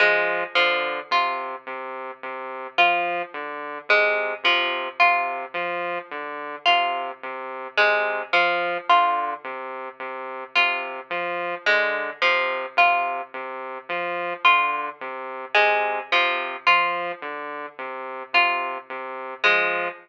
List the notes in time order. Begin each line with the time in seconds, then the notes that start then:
0.00 F3 G#3
0.55 D3 F3
1.11 C3 F4
1.67 C3
2.23 C3
2.78 F3 F4
3.34 D3
3.89 C3 G#3
4.44 C3 F3
5.00 C3 F4
5.54 F3
6.11 D3
6.66 C3 F4
7.23 C3
7.78 C3 G#3
8.33 F3
8.89 D3 F4
9.44 C3
10.00 C3
10.56 C3 F4
11.10 F3
11.66 D3 G#3
12.22 C3 F3
12.77 C3 F4
13.34 C3
13.89 F3
14.44 D3 F4
15.01 C3
15.55 C3 G#3
16.12 C3 F3
16.67 F3 F4
17.22 D3
17.79 C3
18.33 C3 F4
18.90 C3
19.44 F3 G#3